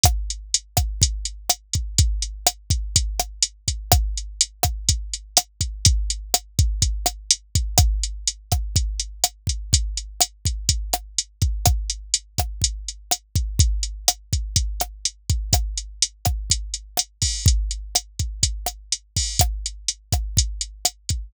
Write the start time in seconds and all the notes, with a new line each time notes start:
0.04 kick, cross-stick, closed hi-hat
0.30 closed hi-hat
0.54 closed hi-hat
0.77 kick, cross-stick, closed hi-hat
1.02 kick, closed hi-hat
1.25 closed hi-hat
1.49 cross-stick, closed hi-hat
1.73 kick, closed hi-hat
1.98 kick, closed hi-hat
2.22 closed hi-hat
2.47 cross-stick, closed hi-hat
2.70 kick, closed hi-hat
2.96 kick, closed hi-hat
3.20 cross-stick, closed hi-hat
3.43 closed hi-hat
3.68 kick, closed hi-hat
3.92 kick, cross-stick, closed hi-hat
4.17 closed hi-hat
4.41 closed hi-hat
4.63 kick, cross-stick, closed hi-hat
4.89 kick, closed hi-hat
5.14 closed hi-hat
5.37 cross-stick, closed hi-hat
5.61 kick, closed hi-hat
5.85 kick, closed hi-hat
6.10 closed hi-hat
6.34 cross-stick, closed hi-hat
6.59 kick, closed hi-hat
6.82 kick, closed hi-hat
7.06 cross-stick, closed hi-hat
7.31 closed hi-hat
7.55 kick, closed hi-hat
7.78 kick, cross-stick, closed hi-hat
8.03 closed hi-hat
8.27 closed hi-hat
8.52 kick, cross-stick, closed hi-hat
8.76 kick, closed hi-hat
9.00 closed hi-hat
9.24 cross-stick, closed hi-hat
9.47 kick, closed hi-hat
9.73 kick, closed hi-hat
9.97 closed hi-hat
10.21 cross-stick, closed hi-hat
10.45 kick, closed hi-hat
10.69 kick, closed hi-hat
10.93 cross-stick, closed hi-hat
11.18 closed hi-hat
11.42 kick, closed hi-hat
11.66 kick, cross-stick, closed hi-hat
11.90 closed hi-hat
12.14 closed hi-hat
12.38 kick, cross-stick, closed hi-hat
12.62 kick, closed hi-hat
12.88 closed hi-hat
13.11 cross-stick, closed hi-hat
13.36 kick, closed hi-hat
13.59 kick, closed hi-hat
13.83 closed hi-hat
14.08 cross-stick, closed hi-hat
14.33 kick, closed hi-hat
14.56 kick, closed hi-hat
14.80 cross-stick, closed hi-hat
15.05 closed hi-hat
15.30 kick, closed hi-hat
15.53 kick, cross-stick, closed hi-hat
15.78 closed hi-hat
16.02 closed hi-hat
16.25 kick, cross-stick, closed hi-hat
16.50 kick, closed hi-hat
16.74 closed hi-hat
16.97 cross-stick, closed hi-hat
17.22 kick, open hi-hat
17.46 kick, closed hi-hat
17.71 closed hi-hat
17.95 cross-stick, closed hi-hat
18.19 kick, closed hi-hat
18.43 kick, closed hi-hat
18.66 cross-stick, closed hi-hat
18.92 closed hi-hat
19.16 kick, open hi-hat
19.39 kick, cross-stick, closed hi-hat
19.66 closed hi-hat
19.88 closed hi-hat
20.13 kick, cross-stick, closed hi-hat
20.37 kick, closed hi-hat
20.61 closed hi-hat
20.85 cross-stick, closed hi-hat
21.09 kick, closed hi-hat